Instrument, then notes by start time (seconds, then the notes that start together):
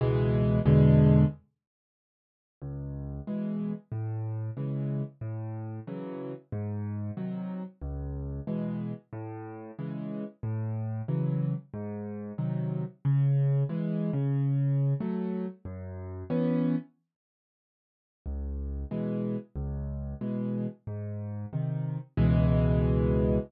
acoustic grand piano
0.01 C#2 B2 E3 G#3
0.65 E2 B2 D3 G#3
2.62 C#2
3.27 B2 E3 G#3
3.92 A2
4.57 C#3 E3 G#3
5.21 A2
5.87 C#3 E3 F#3
6.52 G#2
7.17 C3 D#3 F#3
7.82 C#2
8.47 B2 E3 G#3
9.13 A2
9.79 C#3 E3 G#3
10.43 A2
11.08 C#3 E3 F#3
11.74 G#2
12.38 C3 D#3 F#3
13.05 C#3
13.69 E3 G#3
14.13 C#3
15.00 F#3 A3
15.65 F#2
16.30 E3 B3 C#4
18.26 C#2
18.91 B2 E3 G#3
19.56 C#2
20.21 B2 E3 G#3
20.87 G#2
21.53 C3 D#3
22.17 C#2 B2 E3 G#3